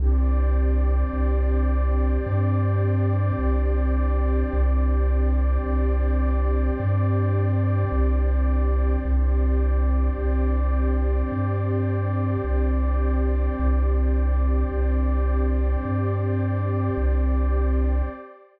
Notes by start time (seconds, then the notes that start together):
0.00 C2 C4 D4 G4 C5 D5
1.13 C2
2.26 G2
3.39 C2
4.53 C2
5.66 C2
6.80 G2
7.92 C2
9.05 C2 C4 D4 G4 C5 D5
10.18 C2
11.32 G2
12.45 C2
13.59 C2
14.72 C2
15.85 G2
16.97 C2